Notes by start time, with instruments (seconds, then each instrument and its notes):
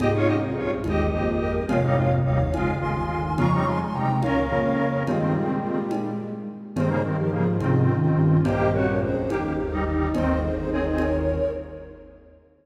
0.00 lead 1 (square) C2 G#2 G4 D#5, flute D#4, ocarina F4 G#4, cowbell, low conga
0.14 lead 1 (square) F4 C#5
0.27 flute C#4, lead 1 (square) G4 D#5
0.41 flute C4, ocarina F4 G#4
0.56 lead 1 (square) A#1 G2 F4 C#5, flute C4
0.84 lead 1 (square) G1 D#2 G4 D#5, flute G#3, ocarina F4 G#4, cowbell, high conga
1.13 lead 1 (square) G#1 F2, flute A#3, ocarina F4 G#4
1.41 ocarina G4 A#4
1.69 lead 1 (square) G#1 F2 G#3 F4, flute C3, ocarina C#5 F5, cowbell, low conga
1.84 lead 1 (square) G3 D#4
1.97 lead 1 (square) G#3 F4
2.25 lead 1 (square) G1 D#2 G3 D#4, ocarina C#5 F5
2.53 lead 1 (square) G#1 F2 G#3 F4, flute C#3, ocarina F5 G#5, cowbell, high conga
2.81 lead 1 (square) G1 D#2, ocarina G#5 C6
3.37 lead 1 (square) F2 C#3 G#3 F4, flute F3, ocarina A#5 C#6, cowbell, low conga
3.52 lead 1 (square) G3 D#4
3.66 flute G3, lead 1 (square) G#3 F4, ocarina G#5 C6
3.80 flute G#3, ocarina G#5 C6
3.94 lead 1 (square) D#2 C3 G3 D#4, flute G#3, ocarina G5 A#5
4.22 lead 1 (square) C#2 A#2 C#4 A#4, flute C#4, ocarina C#5 F5, cowbell, high conga
4.50 lead 1 (square) F2 C#3, flute A#3
5.07 lead 1 (square) G2 D#3 C4, flute G#3, ocarina F4 G#4, cowbell, low conga
5.35 lead 1 (square) A#2 G3
5.62 ocarina F4 G#4
5.91 cowbell, high conga
6.76 lead 1 (square) G2 D#3 C4, flute G#3, ocarina G#4 C5, cowbell, low conga
6.89 lead 1 (square) C#3 A#3
7.03 lead 1 (square) G2 D#3 C4, flute G3, ocarina G4 A#4
7.18 flute F3, ocarina G4 A#4
7.31 lead 1 (square) G#2 C#3 F3 A#3, flute F3, ocarina F4 G#4
7.60 lead 1 (square) C2 G#2 D#3 C4, flute C3, ocarina C#4 F4, cowbell, high conga
7.89 flute D#3
8.17 lead 1 (square) A#1 G2
8.43 lead 1 (square) A#1 G2 A#3 G4, flute A#3, ocarina C5 D#5, cowbell, low conga
8.73 flute C4, lead 1 (square) F#4, ocarina A#4 C#5
8.87 flute C#4, ocarina A#4 C#5
9.01 lead 1 (square) G#1 F2, flute C#4, ocarina G#4 C5
9.29 lead 1 (square) G1 D#2 A#3 G4, flute D#4, ocarina D#4 G4, cowbell, high conga
9.58 lead 1 (square) G1 D#2, flute D#4
9.71 lead 1 (square) G3 D#4
9.86 lead 1 (square) G3 D#4
10.14 lead 1 (square) G1 D#2 D#3 C4, flute D#4, ocarina C5 D#5, cowbell, low conga
10.28 ocarina C5 D#5
10.42 ocarina G#4 C5
10.56 lead 1 (square) G1 D#2, ocarina G#4 C5
10.71 lead 1 (square) C4 G#4, ocarina A#4 C#5
10.86 ocarina C5 D#5
10.98 ocarina A#4 C#5, cowbell, high conga